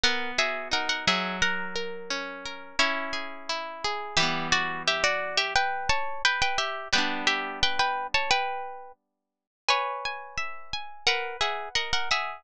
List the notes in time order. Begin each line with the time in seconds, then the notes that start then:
0.03 B3 A#4 F#5
0.38 F#4 G#4 E5
0.71 D#4 A#4 F#5
0.89 A#4 F#5
1.07 F#3 G#4 E5
1.42 A#4 F#5
1.76 A#4
2.10 C#4
2.45 A#4
2.79 C#4 E4 C#5
3.13 G#4
3.49 E4
3.84 G#4
4.17 E3 G3 G4 E5
4.23 B3
4.52 F#4 D5
4.87 G4 E5
5.04 F#4 D5
5.37 G4 E5
5.55 B4 G5
5.89 C#5 A5
6.25 B4 G5
6.42 B4 G5
6.58 G4 E5
6.93 G3 B3 B4 G5
6.98 D4
7.27 G4 E5
7.63 B4 G5
7.79 B4 G5
8.14 C#5 A5
8.31 B4 G5
9.69 B4 C#5 G#5
10.05 G#5
10.37 E5
10.73 G#5
11.07 A#4 B4 F#5
11.41 G#4 E5 F#5
11.75 A#4 D#5 F#5
11.93 A#4 F#5
12.11 G#4 E5 F#5